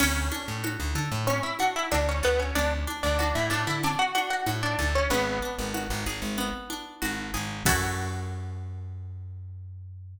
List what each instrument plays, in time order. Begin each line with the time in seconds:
0.00 electric bass (finger) D2, acoustic guitar (steel) C#4 C#5, crash, low conga
0.32 acoustic guitar (steel) D4, high conga
0.48 electric bass (finger) A2
0.64 acoustic guitar (steel) F#4, high conga
0.80 electric bass (finger) D2
0.95 electric bass (finger) D3, acoustic guitar (steel) A4, high conga
1.12 electric bass (finger) A2
1.27 acoustic guitar (steel) C#4 C#5, low conga
1.43 acoustic guitar (steel) E4 E5
1.59 acoustic guitar (steel) D4 F#4 F#5, high conga
1.76 acoustic guitar (steel) E4 E5
1.91 electric bass (finger) D2, acoustic guitar (steel) D4 F#4 D5, high conga
2.09 acoustic guitar (steel) C#4 C#5
2.23 electric bass (finger) D2, acoustic guitar (steel) B3 A4 B4
2.39 acoustic guitar (steel) C#4 C#5
2.55 electric bass (finger) D2, acoustic guitar (steel) C#4 D4 D5, low conga
2.87 acoustic guitar (steel) D4, high conga
3.03 electric bass (finger) D2, acoustic guitar (steel) D4 D5
3.19 acoustic guitar (steel) D4 F#4 D5, high conga
3.35 electric bass (finger) A2, acoustic guitar (steel) E4 E5
3.50 electric bass (finger) A2, acoustic guitar (steel) D4 A4 D5, high conga
3.67 electric bass (finger) D3, acoustic guitar (steel) E4 E5
3.83 acoustic guitar (steel) C#4 D4 D5, low conga
3.99 acoustic guitar (steel) F#4 F#5
4.15 acoustic guitar (steel) D4 F#4 F#5, high conga
4.30 acoustic guitar (steel) F#4 F#5
4.46 electric bass (finger) A2, acoustic guitar (steel) F#4, high conga
4.63 acoustic guitar (steel) D4 D5
4.79 electric bass (finger) D2, acoustic guitar (steel) A4, high conga
4.95 acoustic guitar (steel) C#4 C#5
5.10 electric bass (finger) G#1, acoustic guitar (steel) B3 B4, low conga
5.42 acoustic guitar (steel) D4
5.59 electric bass (finger) G#1
5.74 acoustic guitar (steel) F#4, high conga
5.90 electric bass (finger) G#1
6.06 electric bass (finger) G#1, acoustic guitar (steel) G#4, high conga
6.22 electric bass (finger) G#1
6.38 acoustic guitar (steel) B3, low conga
6.70 acoustic guitar (steel) D4, high conga
7.02 electric bass (finger) G#1, acoustic guitar (steel) F#4, high conga
7.34 electric bass (finger) G#1, acoustic guitar (steel) G#4, high conga
7.65 electric bass (finger) F#2, acoustic guitar (steel) C#4 E4 F#4 A4, kick, crash